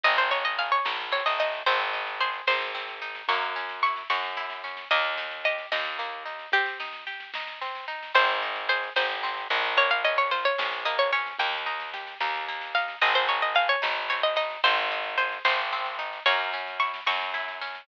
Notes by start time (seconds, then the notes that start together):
0.03 G#1 C4 D#5, kick, snare
0.18 C5, snare
0.31 D#4 C#5, snare
0.45 D#5, snare
0.58 G#4 F5, snare
0.72 C#5, snare
0.85 A#1 D#4, snare
1.00 snare
1.12 C4 C#5, snare
1.26 A1 D#5, snare
1.39 D#4 D#5, snare
1.53 snare
1.66 G#1 C4 C5, kick, snare
1.80 snare
1.93 D#4, snare
2.07 snare
2.20 G#4 C5, snare
2.33 snare
2.47 G#1 D#4 C5, snare
2.61 snare
2.75 C4, snare
2.88 snare
3.02 D#4, snare
3.15 snare
3.28 F#2 A#3 C#6, kick, snare
3.42 snare
3.56 C#4, snare
3.69 snare
3.83 E4 C#6, snare
3.96 snare
4.10 F#2 F#4 C#6, snare
4.24 snare
4.37 E4, snare
4.50 snare
4.64 C#4, snare
4.77 snare
4.91 D#2 A#3 D#5, kick, snare
5.05 snare
5.17 D#4, snare
5.31 snare
5.44 G4 D#5, snare
5.58 snare
5.72 D#2 D#4 D#5, snare
5.85 snare
5.99 A#3, snare
6.26 D#4, snare
6.39 snare
6.52 C4 G4, kick, snare
6.66 snare
6.80 D#4, snare
6.93 snare
7.07 G4, snare
7.20 snare
7.34 D#4, snare
7.47 snare
7.61 C4, snare
7.75 snare
7.88 D#4, snare
8.03 snare
8.15 G#1 C4 C5, kick, snare
8.29 snare
8.42 D#4, snare
8.56 snare
8.69 G#4 C5, snare
8.83 snare
8.96 G#1 D#4 C5, snare
9.09 snare
9.23 C4, snare
9.37 snare
9.50 A#1 D#4, snare
9.64 snare
9.77 A#3 C#5, kick, snare
9.90 F5, snare
10.04 C#4 D#5, snare
10.17 C#5, snare
10.31 F4 C5, snare
10.45 C#5, snare
10.58 A#1 C#4, snare
10.72 snare
10.85 A#3 D#5, snare
10.99 C#5, snare
11.12 C#4 C#5, snare
11.26 snare
11.39 D#2 A#3 G5, kick, snare
11.53 snare
11.66 D#4, snare
11.80 snare
11.94 G4, snare
12.07 snare
12.20 D#2 D#4, snare
12.34 snare
12.48 A#3, snare
12.61 snare
12.75 D#4 F5, snare
12.88 snare
13.01 G#1 C4 D#5, kick, snare
13.15 C5, snare
13.28 D#4 C#5, snare
13.42 D#5, snare
13.55 G#4 F5, snare
13.69 C#5, snare
13.82 G#1 D#4, snare
13.97 snare
14.10 C4 C#5, snare
14.23 D#5, snare
14.36 D#4 D#5, snare
14.50 snare
14.64 G#1 C4 C5, kick, snare
14.78 snare
14.90 D#4, snare
15.04 snare
15.18 G#4 C5, snare
15.32 snare
15.45 G#1 D#4 C5, snare
15.58 snare
15.72 C4, snare
15.85 snare
15.99 D#4, snare
16.13 snare
16.26 F#2 A#3 C#5, kick, snare
16.40 snare
16.53 C#4, snare
16.67 snare
16.80 E4 C#6, snare
16.94 snare
17.06 F#2 F#4 C#6, snare
17.21 snare
17.34 E4, snare
17.48 snare
17.61 C#4, snare
17.75 snare